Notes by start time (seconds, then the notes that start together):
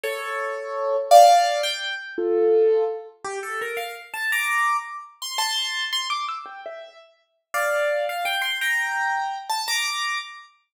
0.03 A4 C#5
1.11 D5 F5
1.63 G5
2.18 F4 A4
3.24 G4
3.43 A4
3.61 A#4
3.77 F5
4.14 A5
4.32 A#5 D6
5.22 C6
5.38 A5 C6
5.93 C6
6.10 D6
6.28 E6
6.46 G5
6.66 E5
7.54 D5 F5
8.09 F5
8.25 G5
8.42 C6
8.61 G5 A#5
9.49 A5
9.68 A#5 D6